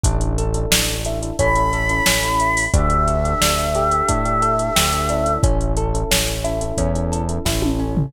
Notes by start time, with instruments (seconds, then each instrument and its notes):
0.04 synth bass 1 A1, acoustic guitar (steel) D4, electric piano 1 D4 E4 A4, kick, closed hi-hat
0.21 closed hi-hat
0.38 acoustic guitar (steel) A4, closed hi-hat
0.54 electric piano 1 D4 E4 A4, closed hi-hat
0.71 synth bass 1 A1, acoustic guitar (steel) D4, snare
0.88 closed hi-hat
1.05 electric piano 1 D4 E4 A4, acoustic guitar (steel) E4, closed hi-hat
1.22 electric piano 1 D4 E4 A4, closed hi-hat
1.39 synth bass 1 A1, electric piano 1 C#4 E4 A4, acoustic guitar (steel) C#4, choir aahs B5, kick, closed hi-hat
1.55 electric piano 1 C#4 E4 A4, closed hi-hat
1.73 acoustic guitar (steel) A4, closed hi-hat
1.89 electric piano 1 C#4 E4 A4, closed hi-hat
2.06 synth bass 1 A1, electric piano 1 C#4 E4 A4, acoustic guitar (steel) C#4, snare
2.23 electric piano 1 C#4 E4 A4, closed hi-hat
2.40 acoustic guitar (steel) E4, closed hi-hat
2.57 open hi-hat
2.73 synth bass 1 D2, acoustic guitar (steel) D4, electric piano 1 D4 G4 A4, choir aahs E5, kick, closed hi-hat
2.90 closed hi-hat
3.07 acoustic guitar (steel) A4, closed hi-hat
3.24 electric piano 1 D4 G4 A4, closed hi-hat
3.41 synth bass 1 D2, acoustic guitar (steel) D4, snare
3.58 closed hi-hat
3.75 electric piano 1 D4 G4 A4, acoustic guitar (steel) G4, closed hi-hat
3.91 electric piano 1 D4 G4 A4, closed hi-hat
4.08 synth bass 1 A2, acoustic guitar (steel) D4, kick, closed hi-hat
4.25 electric piano 1 D4 G4 A4, closed hi-hat
4.42 acoustic guitar (steel) A4, closed hi-hat
4.59 electric piano 1 D4 G4 A4, closed hi-hat
4.76 synth bass 1 D2, electric piano 1 D4 G4 A4, acoustic guitar (steel) G4, snare
4.93 electric piano 1 D4 G4 A4, closed hi-hat
5.09 electric piano 1 C#4 E4 A4, acoustic guitar (steel) D4, closed hi-hat
5.26 closed hi-hat
5.43 synth bass 1 A1, acoustic guitar (steel) C#4, kick, closed hi-hat
5.61 closed hi-hat
5.77 acoustic guitar (steel) A4, closed hi-hat
5.94 electric piano 1 C#4 E4 A4, closed hi-hat
6.11 synth bass 1 A1, acoustic guitar (steel) C#4, snare
6.28 closed hi-hat
6.44 electric piano 1 C#4 E4 A4, acoustic guitar (steel) E4, closed hi-hat
6.61 electric piano 1 C#4 E4 A4, closed hi-hat
6.78 synth bass 1 E2, acoustic guitar (steel) C#4, kick, closed hi-hat
6.95 electric piano 1 C#4 E4 A4, closed hi-hat
7.12 acoustic guitar (steel) A4, closed hi-hat
7.29 electric piano 1 C#4 E4 A4, closed hi-hat
7.45 synth bass 1 A1, electric piano 1 C#4 E4 A4, acoustic guitar (steel) E4, kick, snare
7.62 electric piano 1 C#4 E4 A4, high tom
7.79 acoustic guitar (steel) C#4
7.97 floor tom